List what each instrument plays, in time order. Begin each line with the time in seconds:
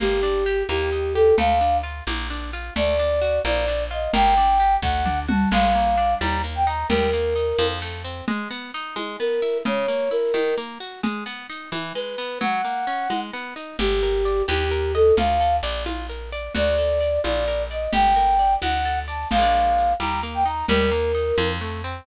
0.00 electric bass (finger) G1, orchestral harp A#3, flute G4, low conga, shaker
0.23 orchestral harp D4, shaker
0.46 orchestral harp G4, shaker
0.69 electric bass (finger) D#2, orchestral harp A#3, flute G4, tambourine, high conga, shaker
0.92 orchestral harp D#4, shaker
1.14 orchestral harp G4, flute A4, shaker
1.38 electric bass (finger) D2, orchestral harp A3, flute F5, low conga, shaker
1.61 orchestral harp D4, shaker
1.83 orchestral harp F4, shaker
2.07 electric bass (finger) A#1, orchestral harp A#3, tambourine, high conga, shaker
2.30 orchestral harp D4, shaker
2.53 orchestral harp F4, shaker
2.76 electric bass (finger) D2, orchestral harp A3, flute D5, low conga, shaker
2.99 orchestral harp D4, shaker
3.21 orchestral harp F#4, shaker
3.45 electric bass (finger) A#1, orchestral harp A#3, flute D5, tambourine, high conga, shaker
3.68 orchestral harp D4, shaker
3.91 orchestral harp F4, flute D#5, shaker
4.13 electric bass (finger) G1, orchestral harp A#3, flute G5, low conga, shaker
4.37 orchestral harp D4, shaker
4.60 orchestral harp G4, shaker
4.82 electric bass (finger) D2, orchestral harp A3, flute F#5, kick
5.05 orchestral harp D4, mid tom
5.28 orchestral harp F#4, flute A5, high tom
5.51 electric bass (finger) A#1, orchestral harp G#3, flute F5, crash, low conga, shaker
5.75 orchestral harp A#3, shaker
5.98 orchestral harp D4, shaker
6.21 electric bass (finger) D#2, orchestral harp G3, flute A#5, tambourine, high conga, shaker
6.44 orchestral harp A#3, shaker
6.55 flute G5
6.67 orchestral harp D#4, flute A#5, shaker
6.89 electric bass (finger) D#2, orchestral harp G3, flute A#4, low conga, shaker
7.12 orchestral harp A#3, shaker
7.36 orchestral harp D#4, shaker
7.59 electric bass (finger) F2, orchestral harp F3, tambourine, high conga, shaker
7.82 orchestral harp A3, shaker
8.04 orchestral harp C4, shaker
8.28 orchestral harp G#3, low conga, shaker
8.50 orchestral harp B3, shaker
8.73 orchestral harp D#4, shaker
8.96 orchestral harp G#3, tambourine, high conga, shaker
9.20 orchestral harp B3, flute A#4, shaker
9.42 orchestral harp E4, shaker
9.65 orchestral harp C#3, flute C#5, low conga, shaker
9.88 orchestral harp A#3, shaker
10.11 orchestral harp E4, flute A#4, shaker
10.34 orchestral harp D#3, tambourine, high conga, shaker
10.57 orchestral harp A#3, shaker
10.80 orchestral harp F#4, shaker
11.03 orchestral harp G#3, low conga, shaker
11.26 orchestral harp B3, shaker
11.50 orchestral harp D#4, shaker
11.72 orchestral harp E3, tambourine, high conga, shaker
11.95 orchestral harp G#3, flute B4, shaker
12.18 orchestral harp B3, shaker
12.41 orchestral harp F#3, flute F#5, low conga, shaker
12.64 orchestral harp A#3, shaker
12.87 orchestral harp C#4, shaker
13.10 orchestral harp G#3, tambourine, high conga, shaker
13.33 orchestral harp B3, shaker
13.56 orchestral harp D#4, shaker
13.79 electric bass (finger) G1, orchestral harp G4, flute G4, low conga, shaker
14.02 orchestral harp A#4, shaker
14.25 orchestral harp D5, shaker
14.48 electric bass (finger) D#2, orchestral harp G4, flute G4, tambourine, high conga, shaker
14.71 orchestral harp A#4, shaker
14.94 flute A4, orchestral harp D#5, shaker
15.17 electric bass (finger) D2, orchestral harp F4, flute F5, low conga, shaker
15.40 orchestral harp A4, shaker
15.63 electric bass (finger) A#1, orchestral harp D5, shaker
15.86 orchestral harp F4, tambourine, high conga, shaker
16.09 orchestral harp A#4, shaker
16.32 orchestral harp D5, shaker
16.55 electric bass (finger) D2, orchestral harp F#4, flute D5, low conga, shaker
16.78 orchestral harp A4, shaker
17.00 orchestral harp D5, shaker
17.24 electric bass (finger) A#1, orchestral harp F4, flute D5, tambourine, high conga, shaker
17.47 orchestral harp A#4, shaker
17.70 orchestral harp D5, flute D#5, shaker
17.93 electric bass (finger) G1, orchestral harp G4, flute G5, low conga, shaker
18.16 orchestral harp A#4, shaker
18.39 orchestral harp D5, shaker
18.62 electric bass (finger) D2, orchestral harp F#4, flute F#5, tambourine, high conga, shaker
18.85 orchestral harp A4, shaker
19.08 orchestral harp D5, flute A5, shaker
19.31 electric bass (finger) A#1, orchestral harp F3, flute F5, low conga, shaker
19.35 orchestral harp G#3 A#3
19.42 orchestral harp D4
19.53 shaker
19.77 shaker
20.00 electric bass (finger) D#2, orchestral harp G3, flute A#5, tambourine, high conga, shaker
20.23 orchestral harp A#3, shaker
20.34 flute G5
20.45 orchestral harp D#4, flute A#5, shaker
20.68 electric bass (finger) D#2, orchestral harp G3, flute A#4, low conga, shaker
20.91 orchestral harp A#3, shaker
21.15 orchestral harp D#4, shaker
21.37 electric bass (finger) F2, orchestral harp F3, tambourine, high conga, shaker
21.61 orchestral harp A3, shaker
21.84 orchestral harp C4, shaker